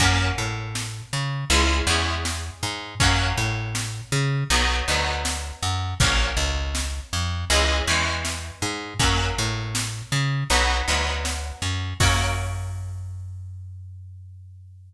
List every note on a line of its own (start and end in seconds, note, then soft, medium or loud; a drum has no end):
0.00 0.32 F#2 loud
0.00 1.38 A#3 loud
0.00 1.38 C#4 loud
0.00 1.38 F#4 medium
0.00 kick medium
0.00 closed hi-hat loud
0.38 1.02 A2 medium
0.75 snare loud
1.13 1.45 C#3 medium
1.50 1.82 C#2 loud
1.50 1.84 G#3 loud
1.50 1.84 C#4 loud
1.50 1.84 E4 loud
1.50 closed hi-hat loud
1.87 2.50 E2 loud
1.87 2.91 G#3 medium
1.87 2.91 C#4 medium
1.87 2.91 E4 medium
2.25 snare loud
2.63 2.95 G#2 medium
3.00 3.33 F#2 medium
3.00 4.38 F#3 loud
3.00 4.38 A#3 medium
3.00 4.38 C#4 loud
3.00 kick loud
3.00 closed hi-hat loud
3.38 4.01 A2 medium
3.75 snare loud
4.12 4.44 C#3 loud
4.50 4.82 B1 loud
4.50 4.85 F#3 medium
4.50 4.85 B3 loud
4.50 4.85 D#4 loud
4.50 closed hi-hat loud
4.88 5.52 D2 medium
4.88 5.91 F#3 medium
4.88 5.91 B3 medium
4.88 5.91 D#4 medium
5.25 snare loud
5.62 5.94 F#2 medium
6.00 6.33 A#1 medium
6.00 7.38 F#3 medium
6.00 7.38 A#3 medium
6.00 7.38 C#4 loud
6.00 kick loud
6.00 closed hi-hat loud
6.37 7.00 C#2 medium
6.75 snare loud
7.13 7.45 F2 medium
7.50 7.82 C#2 loud
7.50 7.84 E3 loud
7.50 7.84 G#3 loud
7.50 7.84 C#4 loud
7.50 closed hi-hat loud
7.87 8.51 E2 medium
7.87 8.91 E3 loud
7.87 8.91 G#3 medium
7.87 8.91 C#4 medium
8.25 snare loud
8.62 8.94 G#2 medium
8.99 9.31 F#2 medium
8.99 10.38 F#3 loud
8.99 10.38 A#3 loud
8.99 10.38 C#4 loud
8.99 kick loud
8.99 closed hi-hat medium
9.38 10.02 A2 medium
9.75 snare loud
10.12 10.44 C#3 medium
10.50 10.82 B1 loud
10.50 10.85 F#3 loud
10.50 10.85 B3 loud
10.50 10.85 D#4 medium
10.50 closed hi-hat medium
10.88 11.52 D2 medium
10.88 11.91 F#3 medium
10.88 11.91 B3 loud
10.88 11.91 D#4 medium
11.25 snare loud
11.62 11.94 F#2 medium
12.00 14.94 F#2 medium
12.00 14.93 A#3 loud
12.00 14.93 C#4 medium
12.00 14.93 F#4 loud
12.00 kick loud
12.00 crash loud